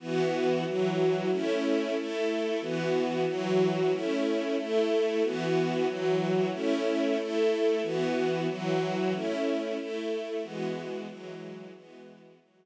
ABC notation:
X:1
M:6/8
L:1/8
Q:3/8=92
K:E
V:1 name="String Ensemble 1"
[E,B,F]3 [E,F,F]3 | [A,CE]3 [A,EA]3 | [E,B,F]3 [E,F,F]3 | [A,CE]3 [A,EA]3 |
[E,B,F]3 [E,F,F]3 | [A,CE]3 [A,EA]3 | [E,B,F]3 [E,F,F]3 | [A,CE]3 [A,EA]3 |
[E,G,B,F]3 [E,F,G,F]3 | [E,G,B,F]3 [E,F,G,F]3 |]